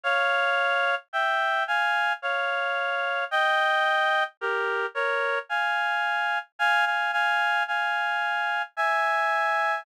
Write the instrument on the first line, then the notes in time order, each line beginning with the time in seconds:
clarinet
0.04 C#5 F5
1.13 E5 G5
1.68 F5 G#5
2.22 C#5 F5
3.31 D#5 G5
4.41 G4 A#4
4.95 A#4 C#5
5.50 F5 G#5
6.59 F5 G#5
6.86 F5 G#5
7.13 F5 G#5
7.68 F5 G#5
8.77 E5 G#5